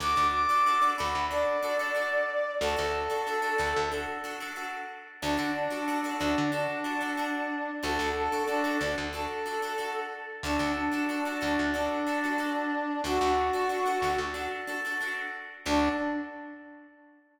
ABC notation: X:1
M:4/4
L:1/16
Q:1/4=92
K:Dmix
V:1 name="Brass Section"
d'2 d'4 b2 d8 | A8 z8 | D2 D4 D2 D8 | A2 A2 D2 D z A6 z2 |
D2 D4 D2 D8 | F8 z8 | D4 z12 |]
V:2 name="Acoustic Guitar (steel)"
[DFA] [DFA]2 [DFA] [DFA] [DFA] [DFA]2 [DFA]2 [DFA] [DFA] [DFA]4 | [DFA] [DFA]2 [DFA] [DFA] [DFA] [DFA]2 [DFA]2 [DFA] [DFA] [DFA]4 | [DFA] [DFA]2 [DFA] [DFA] [DFA] [DFA]2 [DFA]2 [DFA] [DFA] [DFA]4 | [DFA] [DFA]2 [DFA] [DFA] [DFA] [DFA]2 [DFA]2 [DFA] [DFA] [DFA]4 |
[DFA] [DFA]2 [DFA] [DFA] [DFA] [DFA]2 [DFA]2 [DFA] [DFA] [DFA]4 | [DFA] [DFA]2 [DFA] [DFA] [DFA] [DFA]2 [DFA]2 [DFA] [DFA] [DFA]4 | [DFA]4 z12 |]
V:3 name="Electric Bass (finger)" clef=bass
D,, D,,5 D,, D,,9 | D,, D,,5 D,, D,,9 | D,, D,5 D,, D,9 | D,, D,,5 D,, D,,9 |
D,, D,,5 D,, D,,9 | D,, D,,5 D,, D,,9 | D,,4 z12 |]